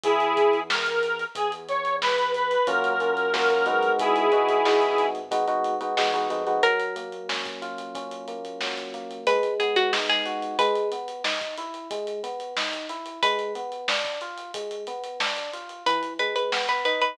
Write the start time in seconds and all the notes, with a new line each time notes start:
0.04 E2 E4 G#4, kick, closed hi-hat
0.20 closed hi-hat
0.37 kick, closed hi-hat
0.53 closed hi-hat
0.70 A#4, snare
0.86 closed hi-hat
1.03 closed hi-hat
1.19 closed hi-hat
1.35 E2 G#4, kick, closed hi-hat
1.52 closed hi-hat
1.69 C#5, closed hi-hat
1.85 closed hi-hat
2.02 B4, snare
2.18 closed hi-hat
2.34 B4, closed hi-hat
2.51 closed hi-hat
2.67 F#2 A#3 C#4 F4 F#4 A#4, kick, closed hi-hat
2.84 closed hi-hat
2.90 A#4
3.00 A#3 C#4 F4 F#4, closed hi-hat
3.12 A#4
3.17 closed hi-hat
3.34 A#3 C#4 F4 F#4 A#4, snare
3.50 A#4, closed hi-hat
3.66 G#3 B3 D#4 F#4, closed hi-hat
3.83 closed hi-hat
3.98 G#1 E4 G#4, kick, closed hi-hat
4.16 closed hi-hat
4.32 G#3 B3 D#4 F#4, kick, closed hi-hat
4.49 kick, closed hi-hat
4.65 G#3 B3 D#4 F#4, snare
4.82 closed hi-hat
4.98 closed hi-hat
5.15 closed hi-hat
5.31 G#3 B3 D#4 F#4, kick, closed hi-hat
5.48 G#3 B3 D#4 F#4, closed hi-hat
5.64 closed hi-hat
5.81 G#3 B3 D#4 F#4, closed hi-hat
5.97 E2 G#3 B3 D#4 F#4, snare
6.14 G#3 B3 D#4 F#4, closed hi-hat
6.30 F2 G#3 B3 D#4 F#4, closed hi-hat
6.47 G#3 B3 D#4 F#4, closed hi-hat
6.63 F#3 A#4, kick, closed hi-hat
6.80 closed hi-hat
6.96 A#3, closed hi-hat
7.12 closed hi-hat
7.29 C#4, snare
7.45 kick, closed hi-hat
7.62 F4, closed hi-hat
7.78 closed hi-hat
7.95 C#4, kick, closed hi-hat
8.11 closed hi-hat
8.28 A#3, closed hi-hat
8.45 closed hi-hat
8.61 F#3, snare
8.77 closed hi-hat
8.94 A#3, closed hi-hat
9.11 closed hi-hat
9.27 G#3 B4, kick, closed hi-hat
9.43 closed hi-hat
9.60 B3 G#4, closed hi-hat
9.76 F#4, closed hi-hat
9.93 D#4, snare
10.09 G#4, closed hi-hat
10.26 F#4, closed hi-hat
10.42 closed hi-hat
10.59 G#3 B4, kick, closed hi-hat
10.76 closed hi-hat
10.92 B3, closed hi-hat
11.08 closed hi-hat
11.24 D#4, snare
11.41 kick, closed hi-hat
11.58 E4, closed hi-hat
11.74 closed hi-hat
11.91 G#3, kick, closed hi-hat
12.07 closed hi-hat
12.23 B3, closed hi-hat
12.40 closed hi-hat
12.57 D#4, snare
12.73 closed hi-hat
12.89 E4, closed hi-hat
13.06 closed hi-hat
13.23 G#3 B4, kick, closed hi-hat
13.39 closed hi-hat
13.55 B3, closed hi-hat
13.72 closed hi-hat
13.88 D4, snare
14.05 kick, closed hi-hat
14.21 F4, closed hi-hat
14.38 closed hi-hat
14.54 G#3, kick, closed hi-hat
14.71 closed hi-hat
14.87 B3, closed hi-hat
15.04 closed hi-hat
15.20 D4, snare
15.37 closed hi-hat
15.53 F4, closed hi-hat
15.69 closed hi-hat
15.86 E3 B4, kick, closed hi-hat
16.03 closed hi-hat
16.19 G#3 B4, closed hi-hat
16.36 B4, closed hi-hat
16.52 B3, snare
16.69 B4, closed hi-hat
16.85 D#4 B4, closed hi-hat
17.02 B4, closed hi-hat